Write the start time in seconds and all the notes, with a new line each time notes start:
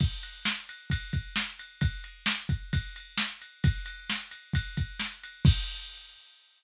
0.00 kick, crash
0.23 ride
0.45 snare
0.69 ride
0.90 kick, ride
1.13 kick, ride
1.36 snare
1.59 ride
1.81 kick, ride
2.04 ride
2.26 snare
2.49 kick, ride
2.73 kick, ride
2.96 ride
3.18 snare
3.42 ride
3.64 kick, ride
3.86 ride
4.10 snare
4.31 ride
4.54 kick, ride
4.77 kick, ride
5.00 snare
5.23 ride
5.45 kick, crash